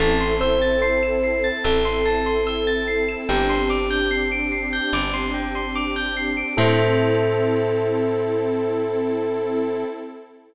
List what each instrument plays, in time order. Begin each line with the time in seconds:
0.00 electric bass (finger) A1, pad 2 (warm) C4 E4 A4, electric piano 1 A4, tubular bells A5
0.21 tubular bells C6
0.41 electric piano 1 C5, tubular bells E6
0.62 tubular bells A6
0.82 electric piano 1 C5, tubular bells C7
1.03 tubular bells E7
1.23 tubular bells C7
1.44 tubular bells A6
1.64 electric bass (finger) A1, electric piano 1 A4, tubular bells E6
1.85 tubular bells C6
2.05 tubular bells A5
2.26 tubular bells C6
2.47 tubular bells E6
2.67 tubular bells A6
2.88 tubular bells C7
3.09 tubular bells E7
3.28 electric bass (finger) G1, pad 2 (warm) C4 D4 G4, electric piano 1 G4, tubular bells G5
3.49 tubular bells C6
3.70 tubular bells D6
3.90 tubular bells G6
4.11 tubular bells C7
4.32 tubular bells D7
4.52 tubular bells C7
4.73 tubular bells G6
4.93 electric bass (finger) G1, tubular bells D6
5.14 tubular bells C6
5.34 tubular bells G5
5.55 tubular bells C6
5.75 tubular bells D6
5.96 tubular bells G6
6.17 tubular bells C7
6.37 tubular bells D7
6.57 electric bass (finger) A2, pad 2 (warm) C4 E4 A4, electric piano 1 A4, tubular bells A4 C5 E5